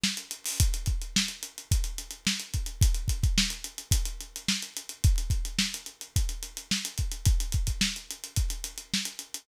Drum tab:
HH |-xxo|xxxx-xxxxxxx-xxx|xxxx-xxxxxxx-xxx|xxxx-xxxxxxx-xxx|
SD |o---|----o-------o---|----o-------o---|----o-------o---|
BD |----|o-o-----o-----o-|o-oo----o-------|o-o-----o-----o-|

HH |xxxx-xxxxxxx-xxx|
SD |----o-------o---|
BD |o-oo----o-------|